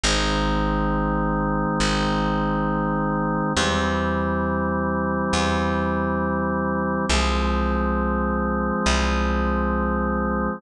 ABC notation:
X:1
M:4/4
L:1/8
Q:1/4=68
K:Cm
V:1 name="Drawbar Organ"
[E,A,C]8 | [=E,G,C]8 | [F,A,C]8 |]
V:2 name="Electric Bass (finger)" clef=bass
A,,,4 A,,,4 | =E,,4 E,,4 | C,,4 C,,4 |]